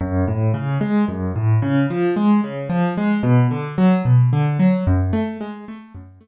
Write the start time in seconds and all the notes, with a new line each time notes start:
0.01 F#2
0.28 A2
0.54 C#3
0.81 G#3
1.08 F#2
1.36 A2
1.62 C#3
1.90 F3
2.16 G#3
2.44 C#3
2.69 F3
2.97 G#3
3.23 B2
3.51 D3
3.78 F#3
4.05 B2
4.33 D3
4.59 F#3
4.87 F#2
5.13 A3
5.41 G#3
5.68 A3
5.95 F#2
6.21 A3